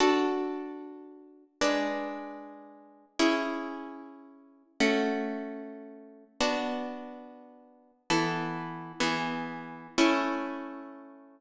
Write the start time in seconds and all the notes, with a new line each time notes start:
0.00 D4 F#4 A4
1.61 G#3 D4 B4
3.19 C#4 E4 G#4
4.80 A3 C#4 F#4
6.41 B3 D4 F#4
8.10 E3 B3 A4
9.00 E3 B3 G#4
9.98 A3 C#4 E4